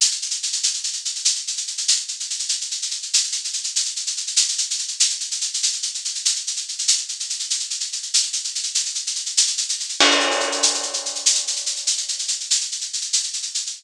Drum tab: CC |------------|------------|------------|------------|
SH |xxxxxxxxxxxx|xxxxxxxxxxxx|xxxxxxxxxxxx|xxxxxxxxxxxx|

CC |------------|------------|------------|------------|
SH |xxxxxxxxxxxx|xxxxxxxxxxxx|xxxxxxxxxxxx|xxxxxxxxxxxx|

CC |x-----------|------------|------------|
SH |-xxxxxxxxxxx|xxxxxxxxxxxx|xxxxxxxxxxxx|